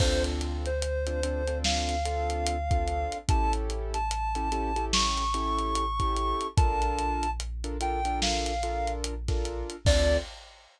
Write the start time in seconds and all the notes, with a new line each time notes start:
0.00 D2 C4 D4 F4 A4 C5, kick, crash
0.24 closed hi-hat
0.41 closed hi-hat
0.66 C5, closed hi-hat
0.82 closed hi-hat
1.07 C4 D4 F4 A4, closed hi-hat
1.23 C4 D4 F4 A4, closed hi-hat
1.47 C4 D4 F4 A4, closed hi-hat
1.64 F5, snare
1.89 snare, closed hi-hat
2.05 C4 D4 F4 A4, closed hi-hat
2.30 closed hi-hat
2.47 closed hi-hat
2.71 C4 D4 F4 A4, kick, closed hi-hat
2.88 closed hi-hat
3.12 closed hi-hat
3.28 A1 C#4 E4 G4 A4 A5, kick, closed hi-hat
3.53 closed hi-hat
3.70 closed hi-hat
3.94 A5, closed hi-hat
4.11 closed hi-hat
4.35 C#4 E4 G4 A4, closed hi-hat
4.52 C#4 E4 G4 A4, closed hi-hat
4.76 C#4 E4 G4 A4, closed hi-hat
4.93 C#6, snare
5.17 closed hi-hat
5.34 C#4 E4 G4 A4, closed hi-hat
5.59 closed hi-hat
5.75 closed hi-hat
6.00 C#4 E4 G4 A4, kick, closed hi-hat
6.16 closed hi-hat
6.41 closed hi-hat
6.57 A#1 D4 F4 A4 A#4 A5, kick, closed hi-hat
6.82 closed hi-hat
6.99 closed hi-hat
7.23 closed hi-hat
7.40 closed hi-hat
7.64 D4 F4 A4 A#4, closed hi-hat
7.81 D4 F4 A4 A#4 G5, closed hi-hat
8.05 D4 F4 A4 A#4, closed hi-hat
8.22 F5, snare
8.46 closed hi-hat
8.63 D4 F4 A4 A#4, closed hi-hat
8.87 closed hi-hat
9.04 closed hi-hat
9.28 D4 F4 A4 A#4, kick, snare, closed hi-hat
9.45 closed hi-hat
9.70 closed hi-hat
9.85 D2 C4 D4 F4 A4 D5, kick, crash